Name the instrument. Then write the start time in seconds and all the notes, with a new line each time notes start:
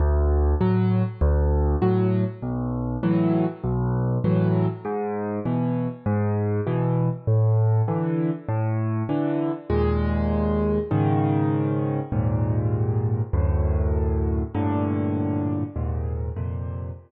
acoustic grand piano
0.00 D2
0.61 A2 F#3
1.21 D2
1.82 A2 F#3
2.42 B1
3.03 A2 E3 F#3
3.64 B1
4.24 A2 E3 F#3
4.85 G#2
5.45 B2 E3
6.06 G#2
6.67 B2 E3
7.27 A2
7.88 D3 E3
8.49 A2
9.09 D3 E3
9.70 D#2 A#2 G#3
10.91 G#2 C#3 D#3
12.12 D#2 G#2 A#2
13.33 D2 F#2 A2
14.55 G2 A2 A#2 D3
15.76 D#2 G#2 A#2
16.36 F2 A#2 C3